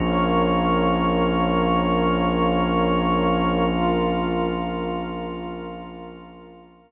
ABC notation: X:1
M:4/4
L:1/8
Q:1/4=65
K:Bbdor
V:1 name="Drawbar Organ"
[B,DF]8- | [B,DF]8 |]
V:2 name="Pad 2 (warm)"
[Bdf]8 | [FBf]8 |]
V:3 name="Synth Bass 2" clef=bass
B,,,8- | B,,,8 |]